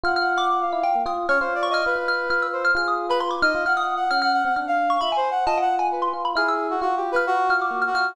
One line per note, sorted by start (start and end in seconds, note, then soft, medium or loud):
0.03 0.64 F4 loud
0.03 0.18 F#5 medium
0.03 0.15 F6 medium
0.16 0.33 F#5 medium
0.16 0.37 F6 medium
0.35 0.48 F#5 medium
0.35 0.78 D6 loud
0.50 0.60 F#5 medium
0.61 1.02 F5 medium
0.73 0.83 E4 loud
0.83 0.93 F4 medium
0.83 1.04 G5 medium
0.95 1.05 A#3 medium
1.06 1.26 F4 loud
1.06 1.27 D#6 medium
1.29 1.39 C#4 loud
1.29 1.39 C#5 loud
1.29 1.59 F6 medium
1.40 1.82 F4 loud
1.40 1.54 C5 medium
1.55 1.68 D5 medium
1.63 1.73 C#6 loud
1.70 1.84 D#5 loud
1.70 2.04 F6 loud
1.86 1.95 F4 medium
1.86 2.47 B4 medium
1.96 2.26 F4 medium
2.08 2.28 F6 medium
2.30 2.71 F4 medium
2.30 2.40 F6 medium
2.42 2.63 E6 medium
2.53 2.73 C5 medium
2.65 2.75 F6 medium
2.75 3.36 F4 loud
2.75 3.06 G#4 medium
2.75 2.87 F6 loud
2.88 3.08 D#6 medium
3.09 3.19 B4 loud
3.09 3.21 B5 loud
3.20 3.31 C6 medium
3.31 3.41 D6 medium
3.42 3.52 D#4 medium
3.42 3.63 D#5 loud
3.42 3.63 F6 loud
3.55 3.65 F4 loud
3.65 4.06 F4 medium
3.65 3.80 F#5 medium
3.65 3.76 F6 medium
3.77 3.94 F#5 medium
3.77 3.97 D#6 medium
3.96 4.09 F#5 medium
4.11 4.42 C#4 medium
4.11 4.21 F#5 medium
4.11 4.21 F6 loud
4.22 4.33 F#5 loud
4.22 4.52 F6 loud
4.33 4.43 F#5 loud
4.45 4.55 C4 medium
4.45 4.55 F#5 loud
4.56 4.97 D4 medium
4.56 4.66 F#5 medium
4.56 4.87 F6 medium
4.67 4.98 F5 loud
4.90 5.00 C#6 loud
5.01 5.12 F4 medium
5.01 5.15 E5 medium
5.01 5.11 B5 loud
5.12 5.42 G#5 medium
5.16 5.30 C5 medium
5.31 5.44 F#5 loud
5.46 6.08 F4 loud
5.46 5.59 D#5 loud
5.46 5.57 A5 loud
5.58 5.78 F#5 medium
5.58 5.75 F#5 loud
5.76 5.90 F#5 medium
5.76 5.99 G#5 medium
5.91 6.12 B4 medium
6.02 6.22 C6 medium
6.13 6.34 F4 medium
6.25 6.35 B5 medium
6.35 6.76 E4 medium
6.35 6.67 G#4 medium
6.35 6.47 F6 medium
6.48 6.79 E6 medium
6.70 6.80 F#4 medium
6.81 7.12 F4 medium
6.81 6.95 F#4 medium
6.96 7.10 G4 medium
7.12 7.45 F4 medium
7.12 7.25 B4 loud
7.16 7.47 F6 medium
7.27 7.54 F#4 loud
7.50 7.70 F4 medium
7.50 7.60 F6 medium
7.57 7.84 F#4 medium
7.62 7.82 D6 medium
7.71 7.91 A#3 medium
7.82 7.92 F6 medium
7.87 8.14 F#4 medium
7.94 8.15 F4 medium
7.94 8.04 F6 loud
8.05 8.15 F6 medium